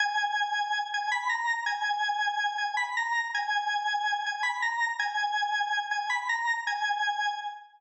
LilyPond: \new Staff { \time 9/8 \key gis \minor \tempo 4. = 108 gis''2~ gis''8 gis''8 b''8 ais''4 | gis''2~ gis''8 gis''8 b''8 ais''4 | gis''2~ gis''8 gis''8 b''8 ais''4 | gis''2~ gis''8 gis''8 b''8 ais''4 |
gis''2 r2 r8 | }